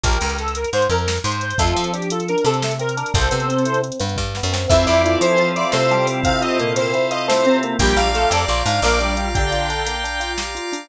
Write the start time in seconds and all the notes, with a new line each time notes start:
0.04 A#1 G4 A#4, kick, closed hi-hat
0.13 closed hi-hat
0.21 C#2, closed hi-hat
0.30 closed hi-hat
0.39 A4, closed hi-hat
0.48 closed hi-hat
0.55 A#4, closed hi-hat
0.64 closed hi-hat
0.73 G#2 C5, closed hi-hat
0.82 closed hi-hat
0.90 F2 A#4, closed hi-hat
0.98 closed hi-hat
1.08 snare
1.17 closed hi-hat
1.24 G#2 C5, closed hi-hat
1.32 closed hi-hat
1.41 C5, closed hi-hat
1.51 closed hi-hat
1.58 F2 A3 F4 A4, kick, closed hi-hat
1.67 closed hi-hat
1.75 F3 C4, closed hi-hat
1.84 closed hi-hat
1.93 D4 G4, closed hi-hat
2.02 closed hi-hat
2.10 F4 A4, closed hi-hat
2.20 closed hi-hat
2.28 D4 A#4, closed hi-hat
2.38 closed hi-hat
2.44 C3 C4 A4, closed hi-hat
2.54 closed hi-hat
2.63 A3, snare
2.71 closed hi-hat
2.79 C4 A#4, closed hi-hat
2.89 closed hi-hat
2.97 D4 A#4, closed hi-hat
3.06 closed hi-hat
3.14 C2 G3 A4 C5, kick, closed hi-hat
3.22 closed hi-hat
3.31 C3 B3, closed hi-hat
3.40 closed hi-hat
3.48 C4, closed hi-hat
3.58 closed hi-hat
3.65 E4, closed hi-hat
3.74 closed hi-hat
3.82 C4, closed hi-hat
3.92 closed hi-hat
3.99 G2 B3, closed hi-hat
4.09 closed hi-hat
4.16 G2 G3, kick, snare
4.35 B3, snare
4.43 F#2
4.53 C4, snare
4.68 F2 E3 C4 E4 F4 A4 E5, kick, crash
4.86 F2 E4 D5, closed hi-hat
5.04 E3 E4 F4, closed hi-hat
5.21 F3 A4 C5, closed hi-hat
5.37 F3 C4 F4, closed hi-hat
5.56 E4 D5, closed hi-hat
5.72 C3 A3 F4 A4 C5, snare
5.90 G3 G4 A4, closed hi-hat
6.07 C4, open hi-hat
6.24 C3 C4 E4 F5, kick, closed hi-hat
6.41 F4 D#5, closed hi-hat
6.59 A#2 A#3 A4, closed hi-hat
6.76 C4 C5, closed hi-hat
6.94 E4, closed hi-hat
7.11 F4 D#5, closed hi-hat
7.28 A2 A3 A4 C5, snare
7.45 C3 C4, closed hi-hat
7.63 A#3, closed hi-hat
7.79 A#1 G3 G4 D5 F5 G5 A#5, kick, closed hi-hat
7.96 A#1 D4 F5, closed hi-hat
8.14 A3 F4 A4, closed hi-hat
8.30 F2 G4 D5, closed hi-hat
8.48 A#1 F4, closed hi-hat
8.66 G#2 D4 F5, closed hi-hat
8.82 A#1 A#3 A#4 D5, snare
9.00 G3 D4 G4, closed hi-hat
9.17 F4, closed hi-hat
9.35 D3 D4 G4 G5, kick, closed hi-hat
9.51 F4, closed hi-hat
9.70 D4, closed hi-hat
9.86 A#3, closed hi-hat
10.04 D4, closed hi-hat
10.20 F4, closed hi-hat
10.38 G4, snare
10.55 F4, closed hi-hat
10.72 D4, open hi-hat